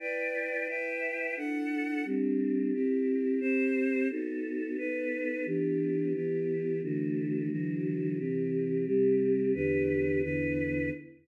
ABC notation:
X:1
M:4/4
L:1/8
Q:1/4=88
K:Em
V:1 name="Choir Aahs"
[EBdg]2 [EBeg]2 [DEAf]2 [G,CD]2 | [CEG]2 [CGc]2 [B,^DFA]2 [B,DAB]2 | [E,B,DG]2 [E,B,EG]2 [D,E,A,F]2 [D,E,F,F]2 | [C,E,G]2 [C,G,G]2 [E,,D,GB]2 [E,,D,EB]2 |]